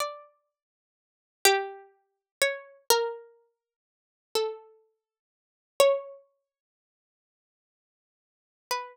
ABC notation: X:1
M:6/8
L:1/8
Q:3/8=41
K:none
V:1 name="Harpsichord"
d3 G2 _d | _B3 A3 | _d6 | B4 z2 |]